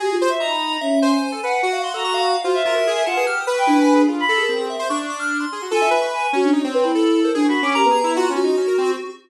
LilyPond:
<<
  \new Staff \with { instrumentName = "Choir Aahs" } { \time 2/4 \tempo 4 = 147 \tuplet 3/2 { g'8 f'8 e''8 } ais''4 | cis'8. r8. fis''8 | r8. ais''8. r8 | fis'16 e''4~ e''16 fis''16 b'16 |
r8. g''16 d'4 | r16 b''8 ais'8 r8. | r2 | gis''8 r8 gis''8 fis'16 d'16 |
r8 b'16 e'4 ais'16 | \tuplet 3/2 { d'8 b''8 d'''8 } g'16 b8. | r2 | }
  \new Staff \with { instrumentName = "Lead 1 (square)" } { \time 2/4 fis'4 ais''16 b''8. | e''8 gis''4. | fis''16 f''16 c'''16 a'16 cis'''16 f''8. | c''8 f'16 ais'8. a''8 |
\tuplet 3/2 { f'''8 dis'''8 cis'''8 e'8 gis''8 gis'8 } | r8. gis'8. e''8 | cis'''16 r16 d'''16 f'''8 c'''8. | f'16 e''8 cis'''16 cis'''4 |
cis''8. b''4 c''16 | r16 cis'''8. ais''4 | f'8 fis'4. | }
  \new Staff \with { instrumentName = "Lead 2 (sawtooth)" } { \time 2/4 gis'8 c''16 r16 dis'4 | r8 c''16 c''8 a'16 b'8 | fis'2 | f'8 ais'16 fis'16 gis'8 f'16 gis'16 |
g'8 b'4. | f'8 a'8 c'8. c''16 | d'4. gis'16 fis'16 | a'8 b'4 cis'8 |
dis'16 c'8. a'4 | \tuplet 3/2 { gis'8 fis'8 cis'8 ais'8 gis'8 e'8 } | \tuplet 3/2 { fis'8 cis'8 dis'8 } cis'16 ais'16 c'8 | }
>>